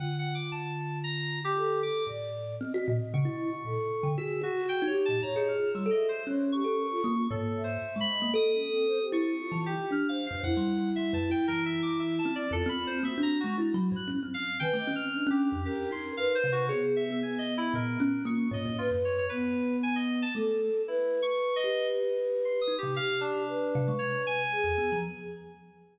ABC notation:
X:1
M:4/4
L:1/16
Q:1/4=115
K:none
V:1 name="Kalimba"
D,16 | A,,4 C ^F ^A,, z ^C, E2 z A,, z2 D, | ^F2 F2 z ^D z ^A,, G,, ^G3 =G, =A2 z | ^C3 A3 ^A,2 ^G,,4 z ^G,2 A, |
A6 E2 z E,2 z D3 ^F,, | F,, G,3 (3G,2 ^F,,2 E2 E,6 C2 | F,, C3 ^A, D2 ^G, (3E2 ^F,2 =G,,2 ^C =C3 | ^D, A, ^C3 C2 F,, z2 ^D4 =C,2 |
^G3 B, z4 ^A,,2 ^C2 ^A,2 ^G,, G,, | z ^F,,3 z8 A,3 z | z6 G8 ^D C, | z6 C, ^G, z5 E,, B, F, |]
V:2 name="Flute"
F12 A4 | d4 ^d8 A4 | (3^G4 ^F4 =G4 (3^c4 =F4 e4 | ^c2 G2 ^A F F2 z2 e4 ^d2 |
(3^d2 ^C2 =C2 c G2 C (3F4 G4 c4 | E16 | F4 ^F8 z4 | (3B2 ^d2 C2 =D4 ^A4 B4 |
B,12 F4 | B4 B,8 A4 | B16 | G4 B8 ^G4 |]
V:3 name="Electric Piano 2"
(3^f2 f2 d'2 a4 ^a3 G3 d'2 | z8 ^c'8 | e'2 ^F2 (3g2 ^c2 a2 ^a ^D =f'2 (3e'2 ^d2 =c2 | z2 ^c'6 (3A4 =c4 b4 |
^d'6 ^c'4 G2 (3f'2 f2 f2 | ^f4 (3e2 a2 g2 (3^A2 e2 d'2 (3e2 =a2 d2 | (3A2 b2 c2 (3e2 ^a2 ^F2 z3 ^f' z2 =f2 | (3g4 f'4 G4 G2 c'2 (3f2 c2 ^F2 |
^c z e2 (3^g2 ^d2 E2 ^A4 ^c'2 d2 | F z ^c c B4 ^g ^d2 a z4 | (3E4 ^c'4 ^d4 z4 (3=c'2 ^d'2 G2 | f2 D6 ^c2 ^g6 |]